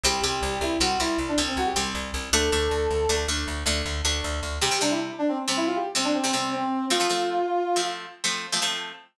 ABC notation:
X:1
M:12/8
L:1/16
Q:3/8=105
K:G
V:1 name="Brass Section"
G2 G4 E2 F2 E2 z D z C F G z6 | A10 z14 | [K:C] G2 D E z2 D C z C E F G z C D C C C2 C4 | F10 z14 |]
V:2 name="Acoustic Guitar (steel)"
[G,C]2 [G,C]6 [G,C]2 [G,C]4 [G,C]4 [G,C]6 | [A,D]2 [A,D]6 [A,D]2 [A,D]4 [A,D]4 [A,D]6 | [K:C] [C,G,C] [C,G,C] [C,G,C]7 [C,G,C]5 [C,G,C]3 [C,G,C] [C,G,C]6 | [F,A,C] [F,A,C] [F,A,C]7 [F,A,C]5 [F,A,C]3 [F,A,C] [F,A,C]6 |]
V:3 name="Electric Bass (finger)" clef=bass
C,,2 C,,2 C,,2 C,,2 C,,2 C,,2 C,,2 C,,2 C,,2 C,,2 C,,2 C,,2 | D,,2 D,,2 D,,2 D,,2 D,,2 D,,2 D,,2 D,,2 D,,2 D,,2 D,,2 D,,2 | [K:C] z24 | z24 |]